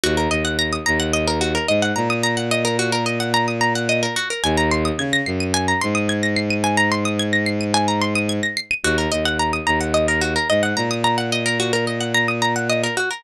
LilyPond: <<
  \new Staff \with { instrumentName = "Pizzicato Strings" } { \time 4/4 \key ees \dorian \tempo 4 = 109 ges'16 bes'16 ees''16 ges''16 bes''16 ees'''16 bes''16 ges''16 ees''16 bes'16 ges'16 bes'16 ees''16 ges''16 bes''16 ees'''16 | bes''16 ges''16 ees''16 bes'16 ges'16 bes'16 ees''16 ges''16 bes''16 ees'''16 bes''16 ges''16 ees''16 bes'16 ges'16 bes'16 | aes''16 bes''16 c'''16 ees'''16 aes'''16 bes'''16 c''''16 ees''''16 aes''16 bes''16 c'''16 ees'''16 aes'''16 bes'''16 c''''16 ees''''16 | aes''16 bes''16 c'''16 ees'''16 aes'''16 bes'''16 c''''16 ees''''16 aes''16 bes''16 c'''16 ees'''16 aes'''16 bes'''16 c''''16 ees''''16 |
ges'16 bes'16 ees''16 ges''16 bes''16 ees'''16 bes''16 ges''16 ees''16 bes'16 ges'16 bes'16 ees''16 ges''16 bes''16 ees'''16 | bes''16 ges''16 ees''16 bes'16 ges'16 bes'16 ees''16 ges''16 bes''16 ees'''16 bes''16 ges''16 ees''16 bes'16 ges'16 bes'16 | }
  \new Staff \with { instrumentName = "Violin" } { \clef bass \time 4/4 \key ees \dorian ees,8 ees,4 ees,4. aes,8 bes,8~ | bes,1 | ees,4 des8 ges,4 aes,4.~ | aes,1 |
ees,8 ees,4 ees,4. aes,8 bes,8~ | bes,1 | }
>>